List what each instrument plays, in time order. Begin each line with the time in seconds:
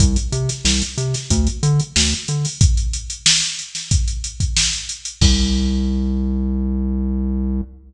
0.00 synth bass 1 C2, kick, closed hi-hat
0.16 closed hi-hat
0.32 synth bass 1 C3, closed hi-hat
0.49 snare, closed hi-hat
0.65 synth bass 1 C2, snare
0.82 closed hi-hat
0.97 synth bass 1 C3, closed hi-hat
1.14 snare, closed hi-hat
1.30 synth bass 1 D2, kick, closed hi-hat
1.47 closed hi-hat
1.63 synth bass 1 D3, closed hi-hat
1.80 closed hi-hat
1.96 synth bass 1 D2, snare
2.12 closed hi-hat
2.28 synth bass 1 D3, closed hi-hat
2.45 open hi-hat
2.61 kick, closed hi-hat
2.77 closed hi-hat
2.93 closed hi-hat
3.10 closed hi-hat
3.26 snare
3.42 closed hi-hat
3.59 closed hi-hat
3.75 snare, closed hi-hat
3.91 kick, closed hi-hat
4.08 closed hi-hat
4.24 closed hi-hat
4.40 kick, closed hi-hat
4.57 snare
4.73 closed hi-hat
4.89 closed hi-hat
5.05 closed hi-hat
5.21 synth bass 1 C2, kick, crash